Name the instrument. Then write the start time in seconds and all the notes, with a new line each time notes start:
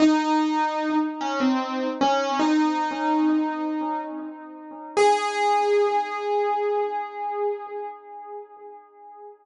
acoustic grand piano
0.00 D#4
1.21 C#4
1.40 C4
2.01 C#4
2.40 D#4
4.97 G#4